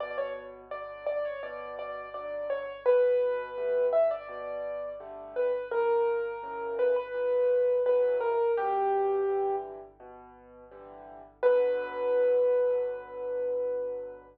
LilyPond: <<
  \new Staff \with { instrumentName = "Acoustic Grand Piano" } { \time 4/4 \key b \minor \tempo 4 = 84 d''16 cis''16 r8 d''8 d''16 cis''16 d''8 d''8 d''8 cis''8 | b'4. e''16 d''4~ d''16 r8 b'8 | ais'4. b'16 b'4~ b'16 b'8 ais'8 | g'4. r2 r8 |
b'1 | }
  \new Staff \with { instrumentName = "Acoustic Grand Piano" } { \time 4/4 \key b \minor b,4 <d fis>4 b,4 <d fis>4 | b,4 <d g a>4 b,4 <d g a>4 | ais,4 <cis e fis>4 ais,4 <cis e fis>4 | b,4 <d e g>4 b,4 <d e g>4 |
<b, d fis>1 | }
>>